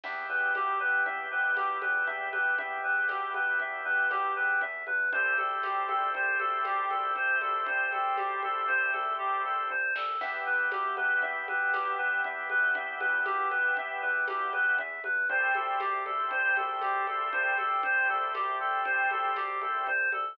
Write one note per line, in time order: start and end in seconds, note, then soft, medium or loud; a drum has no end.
0.03 0.25 E2 medium
0.03 4.62 B3 medium
0.03 4.62 E4 medium
0.03 4.62 G4 medium
0.03 0.27 E5 medium
0.03 crash loud
0.03 low conga loud
0.29 0.51 E2 medium
0.29 0.53 B4 medium
0.55 0.76 E2 medium
0.55 0.79 G4 medium
0.55 tambourine medium
0.55 high conga medium
0.80 1.02 E2 medium
0.80 1.03 B4 medium
1.06 1.27 E2 medium
1.06 1.29 E5 medium
1.06 low conga medium
1.31 1.53 F2 medium
1.31 1.55 B4 medium
1.56 1.78 E2 medium
1.56 1.80 G4 medium
1.56 tambourine medium
1.56 high conga medium
1.82 2.04 E2 medium
1.82 2.05 B4 medium
1.82 high conga medium
2.07 2.29 E2 medium
2.07 2.30 E5 medium
2.07 low conga medium
2.32 2.54 E2 medium
2.32 2.55 B4 medium
2.32 high conga medium
2.58 2.80 E2 medium
2.58 2.81 E5 medium
2.58 low conga loud
2.84 3.05 E2 medium
2.84 3.07 B4 medium
3.09 3.31 E2 medium
3.09 3.32 G4 medium
3.09 tambourine medium
3.09 high conga medium
3.34 3.56 E2 medium
3.34 3.58 B4 medium
3.34 high conga medium
3.60 3.81 E2 medium
3.60 3.84 E5 medium
3.60 low conga medium
3.85 4.07 E2 medium
3.85 4.08 B4 medium
4.11 4.32 E2 medium
4.11 4.34 G4 medium
4.11 tambourine medium
4.11 high conga medium
4.36 4.58 E2 medium
4.36 4.59 B4 medium
4.61 4.83 E2 medium
4.61 4.85 E5 medium
4.61 low conga medium
4.87 5.09 E2 medium
4.87 5.10 B4 medium
4.87 high conga medium
5.12 5.34 C2 medium
5.12 9.70 A3 medium
5.12 9.70 C4 medium
5.12 9.70 E4 medium
5.12 9.70 G4 medium
5.12 5.36 C5 medium
5.12 low conga loud
5.38 5.59 C2 medium
5.38 5.61 A4 medium
5.38 high conga medium
5.63 5.85 C2 medium
5.63 5.87 G4 medium
5.63 tambourine medium
5.63 high conga medium
5.89 6.10 C2 medium
5.89 6.12 A4 medium
5.89 high conga medium
6.14 6.36 C2 medium
6.14 6.38 C5 medium
6.14 low conga medium
6.39 6.61 C2 medium
6.39 6.63 A4 medium
6.39 high conga medium
6.65 6.86 C2 medium
6.65 6.89 G4 medium
6.65 tambourine medium
6.65 high conga medium
6.90 7.12 C2 medium
6.90 7.14 A4 medium
6.90 high conga medium
7.16 7.37 C2 medium
7.16 7.39 C5 medium
7.16 low conga medium
7.41 7.63 C2 medium
7.41 7.65 A4 medium
7.41 high conga medium
7.66 7.88 C2 medium
7.66 7.90 C5 medium
7.66 low conga loud
7.92 8.14 C2 medium
7.92 8.16 A4 medium
7.92 high conga medium
8.17 8.39 C2 medium
8.17 8.40 G4 medium
8.17 tambourine medium
8.17 high conga medium
8.43 8.65 C2 medium
8.43 8.67 A4 medium
8.43 high conga medium
8.68 8.90 C2 medium
8.68 8.91 C5 loud
8.68 low conga medium
8.93 9.15 C2 medium
8.93 9.16 A4 medium
8.93 high conga medium
9.18 9.41 C2 medium
9.18 9.42 G4 medium
9.18 kick medium
9.18 floor tom medium
9.44 9.66 C2 medium
9.44 9.68 A4 medium
9.44 mid tom medium
9.70 9.92 C2 medium
9.70 9.93 C5 medium
9.70 high tom medium
9.95 10.17 C2 medium
9.95 10.20 A4 medium
9.95 snare loud
10.21 10.43 E2 medium
10.21 14.78 B3 medium
10.21 14.78 E4 medium
10.21 14.78 G4 medium
10.21 10.44 E5 medium
10.21 crash loud
10.21 low conga medium
10.46 10.68 E2 medium
10.46 10.70 B4 medium
10.71 10.93 E2 medium
10.71 10.95 G4 medium
10.71 tambourine medium
10.71 high conga loud
10.97 11.19 E2 medium
10.97 11.20 B4 medium
10.97 high conga medium
11.22 11.44 E2 medium
11.22 11.45 E5 medium
11.22 low conga medium
11.48 11.70 E2 medium
11.48 11.72 B4 medium
11.48 high conga medium
11.73 11.95 E2 medium
11.73 11.97 G4 medium
11.73 tambourine medium
11.73 high conga medium
11.98 12.20 E2 medium
11.98 12.22 B4 medium
12.24 12.46 E2 medium
12.24 12.48 E5 medium
12.24 low conga medium
12.50 12.71 E2 medium
12.50 12.73 B4 medium
12.50 high conga medium
12.75 12.97 E2 medium
12.75 12.98 E5 medium
12.75 low conga loud
13.00 13.22 E2 medium
13.00 13.23 B4 medium
13.00 high conga medium
13.25 13.47 E2 medium
13.25 13.49 G4 medium
13.25 tambourine medium
13.25 high conga medium
13.51 13.73 E2 medium
13.51 13.74 B4 medium
13.51 high conga medium
13.77 13.98 E2 medium
13.77 14.01 E5 medium
13.77 low conga loud
14.02 14.24 E2 medium
14.02 14.25 B4 medium
14.28 14.49 E2 medium
14.28 14.51 G4 medium
14.28 tambourine medium
14.28 high conga medium
14.53 14.75 E2 medium
14.53 14.76 B4 medium
14.53 high conga medium
14.78 15.00 E2 medium
14.78 15.02 E5 medium
14.78 low conga medium
15.04 15.26 E2 medium
15.04 15.28 B4 medium
15.04 high conga medium
15.29 15.51 C2 medium
15.29 19.87 A3 medium
15.29 19.87 C4 medium
15.29 19.87 E4 medium
15.29 19.87 G4 medium
15.29 15.53 C5 medium
15.29 low conga medium
15.55 15.76 C2 medium
15.55 15.79 A4 medium
15.55 high conga medium
15.80 16.02 C2 medium
15.80 16.04 G4 medium
15.80 tambourine medium
15.80 high conga medium
16.05 16.27 C2 medium
16.05 16.29 A4 medium
16.05 high conga medium
16.31 16.53 C2 medium
16.31 16.55 C5 medium
16.31 low conga medium
16.56 16.78 C2 medium
16.56 16.80 A4 medium
16.56 high conga medium
16.81 17.03 C2 medium
16.81 17.06 G4 medium
16.81 tambourine medium
16.81 high conga medium
17.07 17.29 C2 medium
17.07 17.30 A4 medium
17.07 high conga medium
17.32 17.54 C2 medium
17.32 17.55 C5 medium
17.32 low conga loud
17.58 17.80 C2 medium
17.58 17.81 A4 medium
17.58 high conga medium
17.83 18.05 C2 medium
17.83 18.07 C5 medium
17.83 low conga loud
18.09 18.31 C2 medium
18.09 18.33 A4 medium
18.34 18.56 C2 medium
18.34 18.58 G4 medium
18.34 tambourine medium
18.34 high conga medium
18.60 18.81 C2 medium
18.60 18.83 A4 medium
18.85 19.07 C2 medium
18.85 19.08 C5 medium
18.85 low conga medium
19.11 19.32 C2 medium
19.11 19.35 A4 medium
19.11 high conga medium
19.36 19.58 C2 medium
19.36 19.60 G4 medium
19.36 tambourine medium
19.36 high conga medium
19.61 19.83 C2 medium
19.61 19.85 A4 medium
19.61 high conga medium
19.87 20.09 C2 medium
19.87 20.10 C5 medium
19.87 low conga medium
20.12 20.34 C2 medium
20.12 20.36 A4 medium
20.12 high conga medium